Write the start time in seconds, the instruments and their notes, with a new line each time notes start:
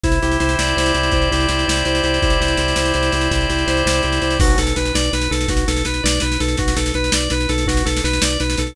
0.03 drawbar organ C2 E4, kick, snare
0.12 snare
0.22 drawbar organ C2 G4, snare
0.32 snare
0.40 drawbar organ C2 C5, snare
0.49 snare
0.58 drawbar organ C2 D5, snare
0.67 snare
0.77 drawbar organ C2 C5, snare
0.86 snare
0.94 drawbar organ C2 G4, snare
1.03 snare
1.11 drawbar organ C2 E4, kick, snare
1.22 snare
1.31 drawbar organ C2 G4, snare
1.40 snare
1.49 drawbar organ C2 C5, snare
1.59 snare
1.67 drawbar organ C2 D5, snare
1.76 snare
1.85 drawbar organ C2 C5, snare
1.95 snare
2.03 drawbar organ C2 G4, snare
2.14 snare
2.22 drawbar organ C2 E4, kick, snare
2.30 snare
2.40 drawbar organ C2 G4, snare
2.48 snare
2.57 drawbar organ C2 C5, snare
2.68 snare
2.76 drawbar organ C2 D5, snare
2.85 snare
2.94 drawbar organ C2 C5, snare
3.03 snare
3.12 drawbar organ C2 G4, snare
3.21 snare
3.31 drawbar organ C2 E4, kick, snare
3.41 snare
3.49 drawbar organ C2 G4, snare
3.58 snare
3.67 drawbar organ C2 C5, snare
3.77 snare
3.86 drawbar organ C2 D5, snare
3.93 snare
4.02 drawbar organ C2 C5, snare
4.12 snare
4.22 drawbar organ C2 G4, snare
4.30 snare
4.40 drawbar organ B1 F#4, kick, snare, crash
4.50 snare
4.58 drawbar organ B1 A4, snare
4.67 snare
4.76 drawbar organ B1 B4, snare
4.85 snare
4.94 drawbar organ B1 D5, snare
5.04 snare
5.13 drawbar organ B1 B4, snare
5.22 snare
5.31 drawbar organ B1 A4, snare
5.41 snare
5.48 drawbar organ B1 F#4, kick, snare
5.57 snare
5.67 drawbar organ B1 A4, snare
5.77 snare
5.85 drawbar organ B1 B4, snare
5.94 snare
6.04 drawbar organ B1 D5, snare
6.14 snare
6.20 drawbar organ B1 B4, snare
6.32 snare
6.40 drawbar organ B1 A4, snare
6.48 snare
6.57 drawbar organ B1 F#4, kick, snare
6.68 snare
6.76 drawbar organ B1 A4, snare
6.86 snare
6.94 drawbar organ B1 B4, snare
7.04 snare
7.12 drawbar organ B1 D5, snare
7.20 snare
7.30 drawbar organ B1 B4, snare
7.40 snare
7.49 drawbar organ B1 A4, snare
7.58 snare
7.66 drawbar organ B1 F#4, kick, snare
7.77 snare
7.85 drawbar organ B1 A4, snare
7.97 snare
8.04 drawbar organ B1 B4, snare
8.13 snare
8.22 drawbar organ B1 D5, snare
8.30 snare
8.40 drawbar organ B1 B4, snare
8.50 snare
8.57 drawbar organ B1 A4, snare
8.67 snare